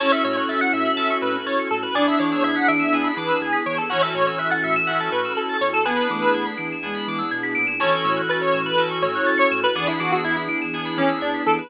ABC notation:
X:1
M:4/4
L:1/16
Q:1/4=123
K:A
V:1 name="Lead 1 (square)"
c e c c e f e4 B2 c2 A B | d e c c e f e4 B2 G2 c A | c e c c e f e4 B2 A2 c A | B6 z10 |
c4 B c2 B2 z c3 c2 B | d E F F E E z4 C2 D2 A B |]
V:2 name="Flute"
C12 z4 | D12 z4 | E,12 z4 | B,2 A,4 z2 G,4 z4 |
E,12 z4 | E,12 z4 |]
V:3 name="Electric Piano 2"
[CEFA]8 [CEFA]8 | [B,DEG]8 [B,DEG]8 | [CEFA]8 [CEFA]8 | [B,DEG]8 [B,DEG]8 |
[CEFA]8 [CEFA]8 | [B,DEG]8 [B,DEG]8 |]
V:4 name="Electric Piano 2"
a c' e' f' a' c'' e'' f'' a c' e' f' a' c'' e'' f'' | g b d' e' g' b' d'' e'' g b d' e' g' b' d'' e'' | f a c' e' f' a' c'' e'' f a c' e' f' a' c'' e'' | g b d' e' g' b' d'' e'' g b d' e' g' b' d'' e'' |
a c' e' f' a' c'' e'' f'' a c' e' f' a' c'' e'' f'' | g b d' e' g' b' d'' e'' g b d' e' g' b' d'' e'' |]
V:5 name="Synth Bass 2" clef=bass
A,,,2 A,,2 A,,,2 A,,2 A,,,2 A,,2 A,,,2 A,,2 | E,,2 E,2 E,,2 E,2 E,,2 E,2 E,,2 E,2 | A,,,2 A,,2 A,,,2 A,,2 A,,,2 A,,2 A,,,2 E,,2- | E,,2 E,2 E,,2 E,2 E,,2 E,2 B,,2 ^A,,2 |
A,,,2 A,,2 A,,,2 A,,2 A,,,2 A,,2 A,,,2 A,,2 | E,,2 E,2 E,,2 E,2 E,,2 E,2 E,,2 E,2 |]
V:6 name="String Ensemble 1"
[CEFA]16 | [B,DEG]16 | [CEFA]16 | [B,DEG]16 |
[CEFA]16 | [B,DEG]16 |]